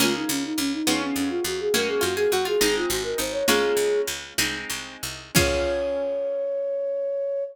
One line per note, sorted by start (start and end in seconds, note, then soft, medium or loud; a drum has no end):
0.00 0.25 C#2 medium
0.00 0.77 A#3 medium
0.00 0.77 C#4 medium
0.00 0.85 C#4 medium
0.00 0.14 F4 loud
0.00 0.85 F4 medium
0.00 0.85 G#4 medium
0.00 low conga loud
0.16 0.30 D#4 medium
0.29 0.54 C#2 medium
0.29 0.43 C#4 loud
0.45 0.59 D#4 loud
0.58 0.82 C#2 medium
0.58 0.72 C#4 loud
0.73 1.00 D#4 loud
0.87 1.12 F2 medium
0.87 1.72 B3 medium
0.87 1.72 C#4 medium
0.87 1.72 F4 loud
0.87 1.72 G#4 medium
0.87 high conga medium
1.02 1.15 C#4 loud
1.16 1.40 F2 medium
1.16 1.30 C#4 loud
1.30 1.43 F4 loud
1.44 1.69 F2 medium
1.44 1.60 F#4 loud
1.60 1.74 G#4 loud
1.74 1.99 F#2 medium
1.74 2.59 A#3 medium
1.74 2.59 C#4 medium
1.74 2.59 F#4 medium
1.74 1.88 A#4 loud
1.74 low conga medium
1.88 2.02 G#4 loud
2.01 2.27 F#2 medium
2.01 2.15 F4 medium
2.01 2.16 F#4 loud
2.17 2.31 G#4 medium
2.32 2.57 F#2 medium
2.32 2.45 F#4 loud
2.32 2.47 F#4 medium
2.45 2.59 F4 medium
2.45 2.75 G#4 loud
2.61 2.86 G#1 medium
2.61 3.46 G#3 loud
2.61 3.46 C4 medium
2.61 3.46 D#4 medium
2.61 2.88 D#4 medium
2.61 high conga medium
2.76 2.90 F4 loud
2.89 3.14 G#1 medium
2.89 3.03 F#4 loud
3.03 3.17 A#4 loud
3.18 3.43 G#1 medium
3.18 3.44 D#4 medium
3.18 3.33 C5 loud
3.32 3.45 C#5 loud
3.47 3.73 C#2 medium
3.47 4.36 G#3 medium
3.47 4.25 A#3 loud
3.47 4.36 C#4 medium
3.47 4.25 C#4 loud
3.47 4.36 F4 medium
3.47 4.01 G#4 loud
3.47 low conga medium
3.77 4.02 C#2 medium
4.07 4.34 C#2 medium
4.38 4.65 C2 medium
4.38 5.34 G#3 medium
4.38 5.34 C4 medium
4.38 5.34 D#4 loud
4.38 high conga medium
4.70 4.97 C2 medium
5.03 5.31 C2 medium
5.35 7.42 C#2 loud
5.35 7.41 C#4 loud
5.35 7.42 C#4 loud
5.35 7.42 F4 medium
5.35 7.42 G#4 loud
5.35 7.44 C#5 loud
5.35 kick loud
5.35 crash loud